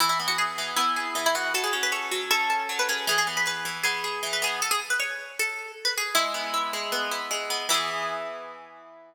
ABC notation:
X:1
M:4/4
L:1/16
Q:1/4=156
K:E
V:1 name="Acoustic Guitar (steel)"
E E z F G4 E4 z E F2 | A G z B c4 A4 z B G2 | G G z B B4 G4 z B G2 | A G z B c4 A4 z B G2 |
E8 z8 | E16 |]
V:2 name="Acoustic Guitar (steel)"
E,2 B,2 z2 E,2 B,2 G2 E,2 B,2 | F,2 C2 A2 F,2 C2 A2 F,2 C2 | E,2 B,2 G2 E,2 B,2 G2 E,2 B,2 | z16 |
G,2 B,2 E2 G,2 B,2 E2 G,2 B,2 | [E,B,G]16 |]